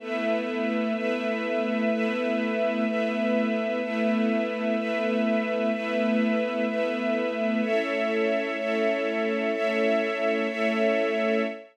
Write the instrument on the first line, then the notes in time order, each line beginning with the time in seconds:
string ensemble 1
0.00 A3 B3 E4 B4 E5
0.95 A3 B3 E4 B4 E5
1.90 A3 B3 E4 B4 E5
2.86 A3 B3 E4 B4 E5
3.81 A3 B3 E4 B4 E5
4.76 A3 B3 E4 B4 E5
5.71 A3 B3 E4 B4 E5
6.67 A3 B3 E4 B4 E5
7.62 A3 C#4 E4 A4 C#5 E5
8.57 A3 C#4 E4 A4 C#5 E5
9.52 A3 C#4 E4 A4 C#5 E5
10.48 A3 C#4 E4 A4 C#5 E5